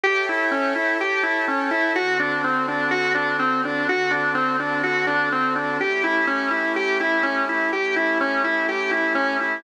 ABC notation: X:1
M:4/4
L:1/8
Q:1/4=125
K:A
V:1 name="Drawbar Organ"
=G E C E G E C E | F D =C D F D C D | F D =C D F D C D | =G E C E G E C E |
=G E C E G E C E |]
V:2 name="Pad 5 (bowed)"
[Ace=g]4 [Acga]4 | [D,=CFA]8 | [D,=CFA]8 | [A,CE=G]8 |
[A,CE=G]8 |]